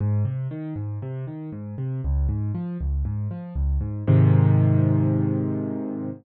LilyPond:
\new Staff { \clef bass \time 4/4 \key aes \major \tempo 4 = 118 aes,8 c8 ees8 aes,8 c8 ees8 aes,8 c8 | des,8 aes,8 f8 des,8 aes,8 f8 des,8 aes,8 | <aes, c ees>1 | }